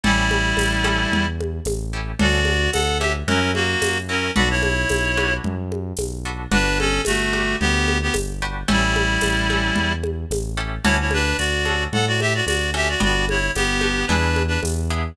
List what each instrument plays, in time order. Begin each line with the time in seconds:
0.03 synth bass 1 A1, clarinet G3 E4, acoustic guitar (steel) C#4 E4 G4 A4, low conga
0.31 high conga
0.57 synth bass 1 A1, tambourine, high conga
0.84 acoustic guitar (steel) C#4 E4 G4 A4, high conga
1.12 synth bass 1 E2, low conga
1.41 high conga
1.65 synth bass 1 A1, tambourine, high conga
1.93 acoustic guitar (steel) C#4 E4 G4 A4
2.19 synth bass 1 D2, acoustic guitar (steel) C#4 D4 F#4 A4, clarinet F#4 D5, low conga
2.45 high conga
2.72 synth bass 1 D2, clarinet A4 F#5, tambourine, high conga
3.00 acoustic guitar (steel) C#4 D4 F#4 A4, clarinet G4 E5, high conga
3.27 synth bass 1 F#2, clarinet C#4 A#4, acoustic guitar (steel) C#4 E4 F#4 A#4, low conga
3.54 clarinet A#3 F#4, high conga
3.82 synth bass 1 F#2, tambourine, high conga
4.09 acoustic guitar (steel) C#4 E4 F#4 A#4, clarinet C#4 A#4
4.36 synth bass 1 B1, acoustic guitar (steel) D4 F#4 A4 B4, clarinet F#4 D5, low conga
4.50 clarinet E4 C#5
4.63 high conga
4.89 synth bass 1 B1, tambourine, high conga
5.17 acoustic guitar (steel) D4 F#4 A4 B4, high conga
5.44 synth bass 1 F#2, low conga
5.72 high conga
5.97 synth bass 1 B1, tambourine, high conga
6.25 acoustic guitar (steel) D4 F#4 A4 B4
6.51 synth bass 1 G1, acoustic guitar (steel) D4 F#4 G4 B4, clarinet D4 B4, low conga
6.79 clarinet C#4 A4, high conga
7.05 synth bass 1 G1, clarinet A3 F#4, tambourine, high conga
7.33 acoustic guitar (steel) D4 F#4 G4 B4, high conga
7.60 synth bass 1 D2, clarinet B3 G4, low conga
7.88 high conga
8.02 clarinet B3 G4
8.14 synth bass 1 G1, tambourine, high conga
8.42 acoustic guitar (steel) D4 F#4 G4 B4
8.68 synth bass 1 A1, clarinet G3 E4, acoustic guitar (steel) C#4 E4 G4 A4, low conga
8.96 high conga
9.21 synth bass 1 A1, tambourine, high conga
9.50 acoustic guitar (steel) C#4 E4 G4 A4, high conga
9.76 synth bass 1 E2, low conga
10.03 high conga
10.30 synth bass 1 A1, tambourine, high conga
10.57 acoustic guitar (steel) C#4 E4 G4 A4
10.84 synth bass 1 D2, acoustic guitar (steel) C#4 D4 F#4 A4, clarinet E4 C#5, low conga
11.00 clarinet E4 C#5
11.11 clarinet D4 B4, high conga
11.38 synth bass 1 D2, clarinet F#4 D5, tambourine
11.65 acoustic guitar (steel) C#4 D4 F#4 A4, high conga
11.93 synth bass 1 A2, clarinet A4 F#5, low conga
12.07 clarinet F#4 D5
12.20 clarinet G4 E5, high conga
12.35 clarinet F#4 D5
12.45 synth bass 1 D2, clarinet F#4 D5, tambourine, high conga
12.74 acoustic guitar (steel) C#4 D4 F#4 A4, clarinet G4 E5
12.89 clarinet F#4 D5
13.00 synth bass 1 G1, acoustic guitar (steel) B3 D4 F#4 G4, clarinet F#4 D5, low conga
13.29 clarinet E4 C#5, high conga
13.55 synth bass 1 G1, clarinet B3 G4, tambourine, high conga
13.81 acoustic guitar (steel) B3 D4 F#4 G4, high conga
14.07 synth bass 1 E2, acoustic guitar (steel) B3 D4 E4 G#4, clarinet D4 B4, low conga
14.36 high conga
14.48 clarinet D4 B4
14.63 synth bass 1 E2, tambourine, high conga
14.90 acoustic guitar (steel) B3 D4 E4 G#4